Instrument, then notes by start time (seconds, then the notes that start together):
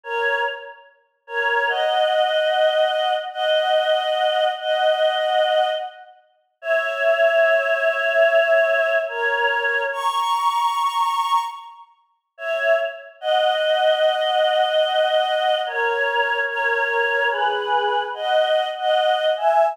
choir aahs
0.04 A#4 C#5
1.27 A#4 C#5
1.68 D#5 F#5
3.33 D#5 F#5
4.58 D#5 F#5
6.62 C#5 E5
9.08 A#4 C#5
9.92 A#5 C#6
12.38 C#5 E5
13.21 D#5 F#5
15.66 A#4 C#5
16.48 A#4 C#5
17.30 G#4 B4
18.14 D#5 F#5
18.77 D#5 F#5
19.37 E5 G#5